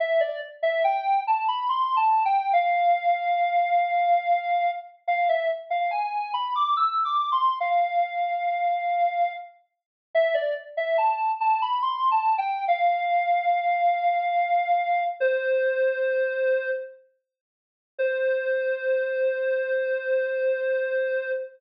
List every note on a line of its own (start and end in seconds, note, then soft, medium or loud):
0.00 0.20 E5 loud
0.20 0.40 D5 medium
0.62 0.83 E5 loud
0.84 1.20 G5 loud
1.27 1.47 A5 medium
1.48 1.68 B5 loud
1.69 1.96 C6 medium
1.96 2.23 A5 loud
2.25 2.52 G5 loud
2.53 4.71 F5 loud
5.08 5.28 F5 loud
5.29 5.49 E5 loud
5.70 5.90 F5 medium
5.91 6.32 G#5 loud
6.34 6.54 B5 loud
6.55 6.76 D6 loud
6.77 7.03 E6 medium
7.05 7.32 D6 loud
7.32 7.59 C6 loud
7.60 9.33 F5 loud
10.15 10.35 E5 loud
10.34 10.54 D5 medium
10.77 10.97 E5 medium
10.98 11.32 A5 medium
11.40 11.61 A5 loud
11.62 11.82 B5 loud
11.82 12.09 C6 loud
12.11 12.38 A5 medium
12.38 12.65 G5 loud
12.68 15.03 F5 loud
15.20 16.70 C5 loud
17.99 21.31 C5 loud